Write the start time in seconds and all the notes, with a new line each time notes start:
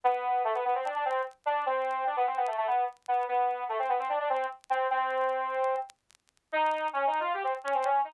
0.04 B3
0.44 A3
0.54 B3
0.64 B3
0.74 C4
0.85 D4
0.95 D4
1.05 C4
1.45 D4
1.65 C4
2.06 D4
2.16 B3
2.26 C4
2.37 B3
2.47 A3
2.57 A3
2.67 B3
3.08 B3
3.28 B3
3.68 A3
3.78 C4
3.89 B3
3.99 C4
4.09 D4
4.19 D4
4.29 C4
4.70 C4
4.90 C4
6.52 D#4
6.93 C#4
7.06 D#4
7.20 F4
7.33 G4
7.43 C4
7.64 C#4
7.74 C4
7.84 C#4
8.04 D#4